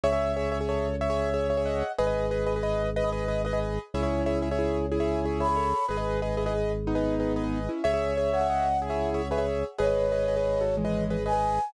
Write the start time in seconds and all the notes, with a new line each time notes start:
0.04 C#2 G#4 C#5 E5
0.12 G#4 C#5 E5
0.37 G#4 C#5 E5
0.52 G#4 C#5 E5
0.61 G#4 C#5 E5
0.69 A4 C#5
1.01 C#5 E5
1.10 G#4 C#5 E5
1.34 G#4 C#5 E5
1.50 G#4 C#5 E5
1.57 G#4 C#5 E5
1.66 D#5 F#5
1.99 G#1 G#4 B4 D#5
2.07 G#4 B4 D#5
2.31 G#4 B4 D#5
2.46 G#4 B4 D#5
2.56 G#4 B4 D#5
2.63 B4 D#5
2.96 B4 D#5
3.04 G#4 B4 D#5
3.12 B4 D#5
3.28 G#4 B4 D#5
3.45 G#4 B4 D#5
3.53 G#4 B4 D#5
3.94 C#2 C#4 E4 G#4 C#5 E5
4.03 G#4 C#5 E5
4.26 G#4 C#5 E5
4.42 G#4 C#5 E5
4.51 G#4 C#5 E5
4.59 E4 G#4
4.92 E4 G#4
5.00 G#4 C#5 E5
5.25 G#4 C#5 E5
5.40 G#4 C#5 E5 B5
5.49 G#4 C#5 E5
5.56 A4 C#5
5.88 G#1 G#4 B4 D#5
5.97 G#4 B4 D#5
6.22 G#4 B4 D#5
6.37 E4 G#4 B4 D#5
6.46 G#4 B4 D#5
6.87 B3 D#4
6.95 G#4 B4 D#5
7.20 G#4 B4 D#5
7.36 G#4 B4 D#5
7.44 G#4 B4 D#5
7.69 C#4 E4
7.84 C#2 G#4 C#5 E5
7.94 G#4 C#5 E5
8.17 G#4 C#5 E5
8.33 G#4 C#5 E5 F#5
8.41 G#4 C#5 E5
8.50 D#5 F#5
8.82 E4 G#4
8.90 G#4 C#5 E5
9.14 G#4 C#5 E5
9.31 G#4 B4 C#5 E5
9.38 G#4 C#5 E5
9.78 G#1 G#4 B4 C#5 D#5
9.87 G#4 B4 D#5
10.12 G#4 B4 D#5
10.28 G#4 B4 D#5
10.37 G#4 B4 D#5
10.61 F#4 A4
10.77 E3 G#3
10.85 G#4 B4 D#5
11.10 G#4 B4 D#5
11.26 G#4 B4 D#5 G#5
11.33 G#4 B4 D#5